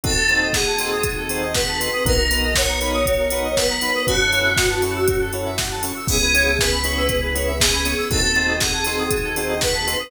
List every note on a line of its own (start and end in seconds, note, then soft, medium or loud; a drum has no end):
0.04 1.89 D#2 medium
0.04 2.03 C4 medium
0.04 0.13 C4 loud
0.04 2.03 D#4 medium
0.04 0.13 D#4 loud
0.04 2.03 F#4 medium
0.04 0.15 F#4 medium
0.04 0.13 F#4 loud
0.04 2.03 A4 medium
0.04 0.13 A4 loud
0.04 0.49 A4 medium
0.04 kick loud
0.04 closed hi-hat loud
0.16 0.28 A4 medium
0.29 0.47 C4 medium
0.29 0.47 D#4 medium
0.29 0.47 F#4 medium
0.29 0.47 A4 loud
0.29 0.40 C5 medium
0.29 closed hi-hat medium
0.42 0.53 D#5 medium
0.53 1.44 G#4 medium
0.53 0.65 F#5 medium
0.53 kick medium
0.53 snare loud
0.67 0.78 A5 medium
0.79 0.97 C4 medium
0.79 0.97 D#4 medium
0.79 0.97 F#4 medium
0.79 0.97 A4 medium
0.79 0.91 C6 medium
0.79 open hi-hat medium
0.92 1.03 D#6 medium
1.03 1.16 F#4 medium
1.03 kick loud
1.03 closed hi-hat loud
1.17 1.28 A4 medium
1.29 1.47 C4 medium
1.29 1.47 D#4 loud
1.29 1.47 F#4 loud
1.29 1.47 A4 medium
1.29 1.41 C5 medium
1.29 open hi-hat medium
1.42 1.54 D#5 medium
1.54 2.04 B4 medium
1.54 1.66 F#5 medium
1.54 kick medium
1.54 snare loud
1.68 1.79 A5 medium
1.80 1.89 C4 medium
1.80 1.89 D#4 medium
1.80 1.89 F#4 loud
1.80 1.89 A4 medium
1.80 1.91 C6 medium
1.80 open hi-hat medium
1.93 2.04 D#6 medium
2.05 3.91 B1 medium
2.05 2.14 B3 loud
2.05 4.05 B3 medium
2.05 2.14 D#4 loud
2.05 4.05 D#4 medium
2.05 2.14 F#4 loud
2.05 2.17 F#4 medium
2.05 4.05 F#4 medium
2.05 2.14 A#4 loud
2.05 4.05 A#4 medium
2.05 2.53 A#4 medium
2.05 kick loud
2.05 closed hi-hat loud
2.18 2.29 A#4 medium
2.31 2.48 B3 medium
2.31 2.48 D#4 medium
2.31 2.48 F#4 medium
2.31 2.48 A#4 medium
2.31 2.42 B4 medium
2.31 open hi-hat medium
2.43 2.55 D#5 medium
2.55 3.53 C#5 medium
2.55 2.67 F#5 medium
2.55 kick medium
2.55 snare loud
2.68 2.80 A#5 medium
2.81 2.99 B3 loud
2.81 2.99 D#4 medium
2.81 2.99 F#4 medium
2.81 2.99 A#4 medium
2.81 2.93 B5 medium
2.81 open hi-hat medium
2.94 3.05 D#6 medium
3.06 3.18 F#4 medium
3.06 kick medium
3.06 closed hi-hat loud
3.19 3.30 A#4 medium
3.30 3.49 B3 loud
3.30 3.49 D#4 medium
3.30 3.49 F#4 medium
3.30 3.49 A#4 medium
3.30 3.43 B4 medium
3.30 open hi-hat medium
3.44 3.55 D#5 medium
3.57 4.03 B4 medium
3.57 3.68 F#5 medium
3.57 kick medium
3.57 snare loud
3.70 3.81 A#5 medium
3.81 3.91 B3 medium
3.81 3.91 D#4 loud
3.81 3.91 F#4 medium
3.81 3.91 A#4 medium
3.81 3.93 B5 medium
3.81 open hi-hat medium
3.95 4.06 D#6 medium
4.07 5.92 F#2 medium
4.07 6.07 C#4 medium
4.07 4.16 C#4 loud
4.07 6.07 E4 medium
4.07 4.16 E4 loud
4.07 6.07 F#4 medium
4.07 4.16 F#4 loud
4.07 4.19 F#4 medium
4.07 5.23 F#4 medium
4.07 6.07 A4 medium
4.07 4.16 A4 loud
4.07 kick loud
4.07 closed hi-hat loud
4.20 4.31 A4 medium
4.32 4.50 C#4 loud
4.32 4.50 E4 medium
4.32 4.50 F#4 medium
4.32 4.50 A4 medium
4.32 4.44 C#5 medium
4.32 open hi-hat medium
4.45 4.56 E5 medium
4.57 4.69 F#5 medium
4.57 kick loud
4.57 snare loud
4.70 4.81 A5 medium
4.82 5.00 C#4 medium
4.82 5.00 E4 loud
4.82 5.00 F#4 medium
4.82 5.00 A4 medium
4.82 4.94 C#6 medium
4.82 open hi-hat medium
4.96 5.07 E6 medium
5.08 5.19 F#4 medium
5.08 kick loud
5.08 closed hi-hat loud
5.21 5.32 A4 medium
5.33 5.51 C#4 medium
5.33 5.51 E4 medium
5.33 5.51 F#4 medium
5.33 5.51 A4 medium
5.33 5.45 C#5 medium
5.33 open hi-hat medium
5.46 5.57 E5 medium
5.58 5.70 F#5 medium
5.58 kick medium
5.58 snare loud
5.71 5.82 A5 medium
5.83 5.92 C#4 medium
5.83 5.92 E4 medium
5.83 5.92 F#4 medium
5.83 5.92 A4 medium
5.83 5.95 C#6 medium
5.83 open hi-hat medium
5.96 6.07 E6 medium
6.08 7.95 C#2 medium
6.08 6.18 B3 loud
6.08 8.09 B3 medium
6.08 6.18 C#4 loud
6.08 8.09 C#4 medium
6.08 6.18 E4 loud
6.08 8.09 E4 medium
6.08 6.20 G#4 medium
6.08 6.18 G#4 loud
6.08 8.09 G#4 medium
6.08 6.57 G#4 medium
6.08 kick loud
6.08 crash loud
6.21 6.33 B4 medium
6.34 6.52 B3 medium
6.34 6.52 C#4 loud
6.34 6.52 E4 medium
6.34 6.52 G#4 medium
6.34 6.45 C#5 medium
6.34 open hi-hat medium
6.47 6.58 E5 medium
6.59 7.51 B4 medium
6.59 6.71 G#5 medium
6.59 kick loud
6.59 snare loud
6.72 6.83 B5 medium
6.84 7.02 B3 medium
6.84 7.02 C#4 medium
6.84 7.02 E4 medium
6.84 7.02 G#4 medium
6.84 6.96 C#6 medium
6.84 open hi-hat medium
6.97 7.08 E6 medium
7.09 7.21 G#4 medium
7.09 kick loud
7.09 closed hi-hat loud
7.22 7.34 B4 medium
7.35 7.53 B3 medium
7.35 7.53 C#4 loud
7.35 7.53 E4 medium
7.35 7.53 G#4 medium
7.35 7.46 C#5 medium
7.35 open hi-hat medium
7.47 7.59 E5 medium
7.60 8.01 G#4 medium
7.60 7.72 G#5 medium
7.60 kick loud
7.60 snare loud
7.73 7.84 B5 medium
7.85 7.94 B3 medium
7.85 7.94 C#4 medium
7.85 7.94 E4 medium
7.85 7.94 G#4 medium
7.85 7.97 C#6 medium
7.85 open hi-hat medium
7.98 8.09 E6 medium
8.10 9.96 D#2 medium
8.10 8.19 C4 loud
8.10 10.10 C4 medium
8.10 8.19 D#4 loud
8.10 10.10 D#4 medium
8.10 8.22 F#4 medium
8.10 8.19 F#4 loud
8.10 10.10 F#4 medium
8.10 8.19 A4 loud
8.10 10.10 A4 medium
8.10 8.55 A4 medium
8.10 kick loud
8.10 closed hi-hat loud
8.23 8.35 A4 medium
8.35 8.53 C4 medium
8.35 8.53 D#4 medium
8.35 8.53 F#4 medium
8.35 8.53 A4 loud
8.35 8.47 C5 medium
8.35 closed hi-hat medium
8.48 8.60 D#5 medium
8.60 9.51 G#4 medium
8.60 8.72 F#5 medium
8.60 kick medium
8.60 snare loud
8.73 8.85 A5 medium
8.85 9.04 C4 medium
8.85 9.04 D#4 medium
8.85 9.04 F#4 medium
8.85 9.04 A4 medium
8.85 8.98 C6 medium
8.85 open hi-hat medium
8.99 9.10 D#6 medium
9.11 9.23 F#4 medium
9.11 kick loud
9.11 closed hi-hat loud
9.24 9.35 A4 medium
9.36 9.54 C4 medium
9.36 9.54 D#4 loud
9.36 9.54 F#4 loud
9.36 9.54 A4 medium
9.36 9.48 C5 medium
9.36 open hi-hat medium
9.49 9.61 D#5 medium
9.61 10.10 B4 medium
9.61 9.73 F#5 medium
9.61 kick medium
9.61 snare loud
9.74 9.86 A5 medium
9.87 9.96 C4 medium
9.87 9.96 D#4 medium
9.87 9.96 F#4 loud
9.87 9.96 A4 medium
9.87 9.98 C6 medium
9.87 open hi-hat medium
9.99 10.10 D#6 medium